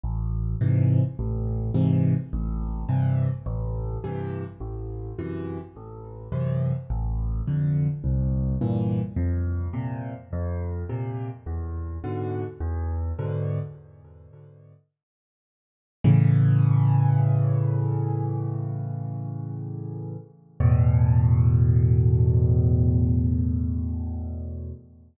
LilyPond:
\new Staff { \clef bass \time 4/4 \key a \minor \tempo 4 = 105 a,,4 <gis, c e>4 a,,4 <gis, c e>4 | a,,4 <g, c e>4 a,,4 <g, c e>4 | a,,4 <fis, c e>4 a,,4 <fis, c e>4 | a,,4 <f, d>4 c,4 <g, bes, e>4 |
f,4 <bes, c>4 f,4 <bes, c>4 | e,4 <gis, b, d>4 e,4 <gis, b, d>4 | r1 | \key a \major <a, cis e>1~ |
<a, cis e>1 | <e, a, b,>1~ | <e, a, b,>1 | }